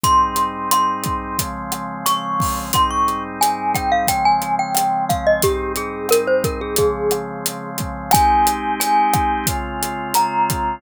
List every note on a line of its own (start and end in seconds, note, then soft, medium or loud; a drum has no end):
0.04 1.37 G#2 medium
0.04 1.37 G3 medium
0.04 1.37 C4 medium
0.04 1.37 D#4 medium
0.04 0.69 C6 loud
0.04 kick medium
0.04 closed hi-hat medium
0.36 closed hi-hat medium
0.71 1.96 C6 medium
0.71 cross-stick medium
0.71 closed hi-hat medium
1.04 kick medium
1.04 closed hi-hat medium
1.39 2.72 C#3 medium
1.39 2.72 F3 medium
1.39 2.72 G#3 medium
1.39 2.72 C4 medium
1.39 kick medium
1.39 closed hi-hat medium
1.72 cross-stick medium
1.72 closed hi-hat medium
2.06 2.66 C#6 loud
2.06 closed hi-hat loud
2.40 kick medium
2.40 open hi-hat medium
2.73 4.07 G#2 medium
2.73 4.07 G3 medium
2.73 4.07 C4 medium
2.73 4.07 D#4 medium
2.73 2.90 C6 loud
2.73 kick medium
2.73 cross-stick medium
2.73 closed hi-hat medium
2.91 3.23 C#6 medium
3.08 closed hi-hat soft
3.41 3.73 G#5 loud
3.41 closed hi-hat medium
3.75 3.91 G5 medium
3.75 kick medium
3.75 cross-stick medium
3.75 closed hi-hat medium
3.92 4.08 F5 medium
4.07 5.42 C#3 medium
4.07 5.42 F3 medium
4.07 5.42 G#3 medium
4.07 5.42 C4 medium
4.07 4.24 G5 medium
4.07 kick medium
4.07 closed hi-hat medium
4.25 4.55 G#5 loud
4.42 closed hi-hat medium
4.59 5.05 G5 medium
4.75 cross-stick medium
4.75 closed hi-hat medium
5.09 5.25 F5 medium
5.09 kick medium
5.09 closed hi-hat medium
5.27 5.43 D#5 loud
5.42 6.77 G#2 medium
5.42 6.77 G3 medium
5.42 6.77 C4 medium
5.42 6.77 D#4 medium
5.42 5.72 G4 loud
5.42 kick medium
5.42 closed hi-hat loud
5.76 6.07 G#4 medium
5.76 closed hi-hat medium
6.09 6.27 A#4 loud
6.09 cross-stick medium
6.09 closed hi-hat medium
6.27 6.43 C5 medium
6.44 6.61 A#4 medium
6.44 kick medium
6.44 closed hi-hat medium
6.61 6.77 G#4 medium
6.76 8.12 C#3 medium
6.76 8.12 F3 medium
6.76 8.12 G#3 medium
6.76 8.12 C4 medium
6.76 7.70 G#4 medium
6.76 kick medium
6.76 closed hi-hat medium
7.11 cross-stick medium
7.11 closed hi-hat medium
7.46 closed hi-hat medium
7.78 kick medium
7.78 closed hi-hat medium
8.11 9.46 G#3 loud
8.11 9.46 C4 medium
8.11 9.46 D#4 loud
8.11 9.46 G4 loud
8.11 8.75 G#5 loud
8.11 kick medium
8.11 cross-stick loud
8.11 closed hi-hat loud
8.47 closed hi-hat medium
8.80 10.08 G#5 loud
8.80 closed hi-hat loud
9.14 kick medium
9.14 cross-stick medium
9.14 closed hi-hat medium
9.47 10.81 C#3 medium
9.47 10.81 G#3 medium
9.47 10.81 C4 medium
9.47 10.81 F4 loud
9.47 kick medium
9.47 closed hi-hat medium
9.83 closed hi-hat medium
10.14 10.75 A#5 loud
10.14 cross-stick medium
10.14 closed hi-hat loud
10.50 kick medium
10.50 closed hi-hat medium